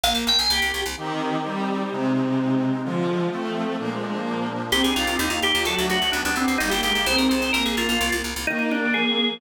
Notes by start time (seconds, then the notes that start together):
0.04 A#1 A#3 F5
0.15 A#1
0.27 A#1 G5
0.39 A#1 G#5
0.50 C2 G4
0.62 C2
0.74 C2
0.86 C2
0.97 D#3 C4 D#4 G4
1.44 G3
1.91 C3 G#3 C4 D#4
2.84 D3 F3 G#3 F4
3.31 F3 A3 C4
3.78 A#2 F3 A#3 D4
3.90 G#3
4.02 G#3
4.13 A#3
4.72 C2 C4 D#4 G4
4.83 C2 D4 G#4
4.96 C2 D#4 F4
5.07 C2
5.19 D#2 A#3 D#4 G4
5.30 D#2 F4
5.42 D#2 D#4 G4
5.54 D#2 F4
5.65 D2 F#3 A3 D4 F#4 A4
5.76 D2 F#4
5.89 D2 F#4
6.02 D2
6.12 D2 B3 D4 G4
6.25 D2 D4
6.36 D2 C4
6.48 D2
6.58 G1 G3 A#3 D#4 G4
6.70 G1 A#3 G4
6.83 G1 G#3 G4
6.95 G1
7.06 C2 C4 D#4 G#4 C5
7.17 C2 A#4
7.29 C2 C5
7.42 C2
7.53 A#1 A#3 A#4
7.65 A#1 G#4
7.77 A#1 F4
7.89 A#1 F4
8.01 C2
8.12 C2
8.24 C2
8.36 C2
8.47 D#3 A#3 D#4
8.59 A#3 D#4
8.71 D4 G4
8.82 D#3
8.94 F3 G#4
9.07 C4
9.16 G#4
9.28 F3